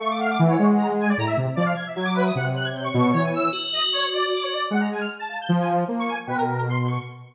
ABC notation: X:1
M:6/8
L:1/16
Q:3/8=102
K:none
V:1 name="Lead 2 (sawtooth)"
A,4 E,2 ^G,6 | A,,2 C, z F,2 z2 ^F,4 | C,6 B,,2 E,4 | z12 |
^G,4 z4 F,4 | ^A,3 z B,,8 |]
V:2 name="Lead 1 (square)"
^c' d' f d' z ^c2 z ^a z ^g d | ^a e z2 d f ^g' e g' d' B ^d' | ^f z ^f' ^g' =g' ^c'3 ^c ^g e'2 | z2 ^d z ^c2 =d2 d' c d2 |
^f ^a ^g =f' z =a2 =g' z ^g z2 | z ^c' ^g z B ^A3 =c'2 ^c'2 |]
V:3 name="Tubular Bells"
f2 ^f8 z2 | z10 e2 | z2 ^c10 | ^F12 |
z6 f6 | z4 g2 z6 |]